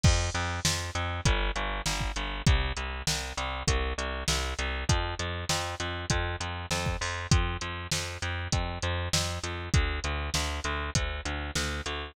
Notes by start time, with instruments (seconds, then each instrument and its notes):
0.03 electric bass (finger) F2, kick, crash
0.34 electric bass (finger) F2, closed hi-hat
0.65 electric bass (finger) F2, snare
0.95 electric bass (finger) F2, closed hi-hat
1.25 electric bass (finger) G1, kick, closed hi-hat
1.56 electric bass (finger) G1, closed hi-hat
1.86 electric bass (finger) G1, snare
2.01 kick
2.16 electric bass (finger) G1, closed hi-hat
2.46 electric bass (finger) C2, kick, closed hi-hat
2.77 electric bass (finger) C2, closed hi-hat
3.07 electric bass (finger) C2, snare
3.37 electric bass (finger) C2, closed hi-hat
3.67 electric bass (finger) C2, kick, closed hi-hat
3.98 electric bass (finger) C2, closed hi-hat
4.28 electric bass (finger) C2, snare
4.59 electric bass (finger) C2, closed hi-hat
4.89 electric bass (finger) F2, kick, closed hi-hat
5.19 electric bass (finger) F2, closed hi-hat
5.49 electric bass (finger) F2, snare
5.80 electric bass (finger) F2, closed hi-hat
6.10 electric bass (finger) F2, kick, closed hi-hat
6.40 electric bass (finger) F2, closed hi-hat
6.71 electric bass (finger) F2, snare
6.86 kick
7.01 electric bass (finger) F2, open hi-hat
7.31 electric bass (finger) F2, kick, closed hi-hat
7.61 electric bass (finger) F2, closed hi-hat
7.91 electric bass (finger) F2, snare
8.22 electric bass (finger) F2, closed hi-hat
8.52 electric bass (finger) F2, kick, closed hi-hat
8.82 electric bass (finger) F2, closed hi-hat
9.13 electric bass (finger) F2, snare
9.43 electric bass (finger) F2, closed hi-hat
9.74 electric bass (finger) D2, kick, closed hi-hat
10.04 electric bass (finger) D2, closed hi-hat
10.34 electric bass (finger) D2, snare
10.64 electric bass (finger) D2, closed hi-hat
10.95 electric bass (finger) D2, kick, closed hi-hat
11.25 electric bass (finger) D2, closed hi-hat
11.55 electric bass (finger) D2, snare
11.86 electric bass (finger) D2, closed hi-hat